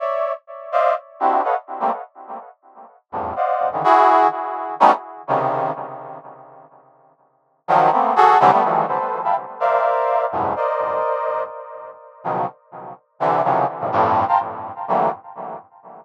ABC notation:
X:1
M:2/4
L:1/16
Q:1/4=125
K:none
V:1 name="Brass Section"
[^cde]3 z3 [=cd^def]2 | z2 [CDE^FG]2 [AB^c^d=f^f] z2 [G,A,^A,=C] | z8 | z2 [E,,F,,G,,A,,]2 [cd^df^f]3 [^C,=D,^D,E,] |
[E^F^G]4 z4 | [^F,G,A,B,^C^D] z3 [=C,^C,^D,]4 | z8 | z8 |
[^D,F,^F,]2 [A,^A,B,C]2 [^F^G=A]2 [C,=D,E,F,=G,] [G,=A,B,] | [^D,E,F,G,A,]2 [ABc]3 [efgab] z2 | [^Acdef]6 [E,,^F,,G,,^G,,=A,,B,,]2 | [^Acd^d]8 |
z6 [B,,^C,^D,F,^F,]2 | z6 [C,D,E,]2 | [C,^C,^D,E,F,^F,]2 z [G,,A,,B,,C,D,=F,] [F,,G,,A,,]3 [fga^a=c'] | z4 [D,E,^F,G,A,^A,]2 z2 |]